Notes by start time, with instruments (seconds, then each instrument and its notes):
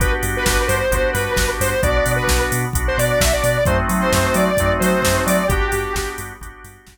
0.00 synth bass 2 G1, drawbar organ B3 D4 F#4 G4, lead 1 (square) B4, kick, closed hi-hat
0.23 synth bass 2 G2, open hi-hat
0.37 lead 1 (square) B4
0.46 synth bass 2 G1, lead 1 (square) B4, kick, snare
0.66 synth bass 2 G2, lead 1 (square) C5, open hi-hat
0.91 synth bass 2 G1, drawbar organ B3 D4 F#4 G4, kick, closed hi-hat
1.12 synth bass 2 G2, lead 1 (square) B4, open hi-hat
1.36 synth bass 2 G1, kick, snare
1.60 synth bass 2 G2, lead 1 (square) C5, open hi-hat
1.83 synth bass 2 B1, drawbar organ B3 D4 F#4, lead 1 (square) D5, kick, closed hi-hat
2.06 synth bass 2 B2, open hi-hat
2.16 lead 1 (square) B4
2.28 synth bass 2 B1, kick, snare
2.52 synth bass 2 B2, open hi-hat
2.73 synth bass 2 B1, drawbar organ B3 D4 F#4, kick, closed hi-hat
2.88 lead 1 (square) C5
2.98 synth bass 2 B2, lead 1 (square) D5, open hi-hat
3.21 synth bass 2 B1, lead 1 (square) E5, kick, snare
3.33 lead 1 (square) D5
3.44 synth bass 2 B2, open hi-hat
3.65 synth bass 2 F#2, drawbar organ A3 C4 D#4 F#4, lead 1 (square) C5, kick, closed hi-hat
3.89 synth bass 2 F#3, open hi-hat
4.01 lead 1 (square) C5
4.12 synth bass 2 F#2, lead 1 (square) C5, kick, snare
4.34 synth bass 2 F#3, lead 1 (square) D5, open hi-hat
4.57 synth bass 2 F#2, drawbar organ A3 C4 D#4 F#4, kick, closed hi-hat
4.80 synth bass 2 F#3, lead 1 (square) C5, open hi-hat
5.02 synth bass 2 F#2, kick, snare
5.26 synth bass 2 F#3, lead 1 (square) D5, open hi-hat
5.48 synth bass 2 G1, drawbar organ B3 D4 F#4 G4, lead 1 (square) G4, kick, closed hi-hat
5.72 synth bass 2 G2, open hi-hat
5.95 synth bass 2 G1, kick, snare
6.18 synth bass 2 G2, open hi-hat
6.41 synth bass 2 G1, drawbar organ B3 D4 F#4 G4, kick, closed hi-hat
6.64 synth bass 2 G2, open hi-hat
6.87 synth bass 2 G1, kick, snare